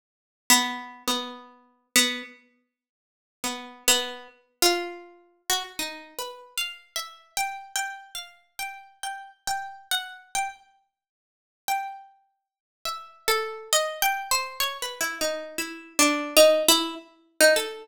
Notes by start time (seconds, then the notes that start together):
0.50 B3
1.08 B3
1.96 B3
3.44 B3
3.88 B3
4.62 F4
5.50 F#4
5.79 D#4
6.19 B4
6.58 F5
6.96 E5
7.37 G5
7.76 G5
8.15 F5
8.59 G5
9.03 G5
9.47 G5
9.91 F#5
10.35 G5
11.68 G5
12.85 E5
13.28 A4
13.73 D#5
14.02 G5
14.31 C5
14.60 C#5
14.82 B4
15.01 E4
15.21 D#4
15.58 E4
15.99 D4
16.37 D#4
16.68 E4
17.41 D#4
17.56 A4